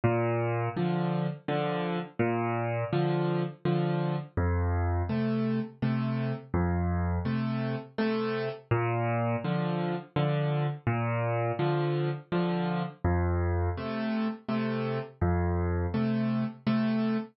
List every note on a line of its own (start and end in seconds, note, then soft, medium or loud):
0.04 0.69 A#2 loud
0.77 1.27 D3 loud
0.77 1.27 F3 loud
1.48 1.99 D3 loud
1.48 1.99 F3 medium
2.19 2.84 A#2 loud
2.93 3.43 D3 loud
2.93 3.43 F3 loud
3.65 4.16 D3 medium
3.65 4.16 F3 loud
4.37 5.02 F2 loud
5.09 5.60 C3 medium
5.09 5.60 A3 medium
5.82 6.33 C3 loud
5.82 6.33 A3 medium
6.54 7.19 F2 loud
7.25 7.76 C3 medium
7.25 7.76 A3 medium
7.98 8.49 C3 medium
7.98 8.49 A3 loud
8.71 9.36 A#2 loud
9.44 9.95 D3 loud
9.44 9.95 F3 loud
10.16 10.67 D3 loud
10.16 10.67 F3 medium
10.87 11.52 A#2 loud
11.59 12.10 D3 loud
11.59 12.10 F3 loud
12.32 12.83 D3 loud
12.32 12.83 F3 loud
13.04 13.69 F2 loud
13.77 14.28 C3 medium
13.77 14.28 A3 medium
14.48 14.99 C3 loud
14.48 14.99 A3 medium
15.21 15.86 F2 loud
15.94 16.44 C3 medium
15.94 16.44 A3 medium
16.67 17.17 C3 loud
16.67 17.17 A3 loud